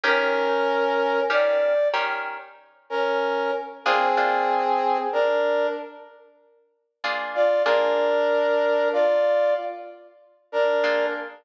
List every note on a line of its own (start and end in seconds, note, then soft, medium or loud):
0.03 0.48 D#3 medium
0.03 0.48 C#4 medium
0.03 1.21 C#4 medium
0.03 0.48 G4 medium
0.03 0.48 A#4 medium
0.03 1.21 A#4 loud
1.30 1.74 D#3 medium
1.30 1.74 C#4 medium
1.30 1.74 G4 medium
1.30 1.74 A#4 medium
1.30 1.88 D5 medium
1.94 2.38 D#3 medium
1.94 2.38 C#4 medium
1.94 2.38 G4 medium
1.94 2.38 A#4 medium
2.90 3.51 C#4 medium
2.90 3.51 A#4 medium
3.85 4.08 A#3 medium
3.85 4.97 C4 medium
3.85 4.08 D4 medium
3.85 4.08 F4 medium
3.85 4.97 G#4 loud
3.85 4.08 G#4 medium
4.17 4.62 A#3 medium
4.17 4.62 D4 medium
4.17 4.62 F4 medium
4.17 4.62 G#4 medium
5.12 5.67 D4 medium
5.12 5.67 A#4 medium
7.04 7.48 A#3 medium
7.04 7.48 D4 medium
7.04 7.48 F4 medium
7.04 7.48 G#4 medium
7.35 7.63 F4 medium
7.35 7.63 D5 medium
7.65 8.10 A#3 medium
7.65 8.88 D4 medium
7.65 8.10 D4 medium
7.65 8.10 F4 medium
7.65 8.10 G#4 medium
7.65 8.88 A#4 loud
8.92 9.54 F4 medium
8.92 9.54 D5 medium
10.52 11.06 D4 medium
10.52 11.06 A#4 medium
10.83 11.28 A#3 medium
10.83 11.28 D4 medium
10.83 11.28 F4 medium
10.83 11.28 G#4 medium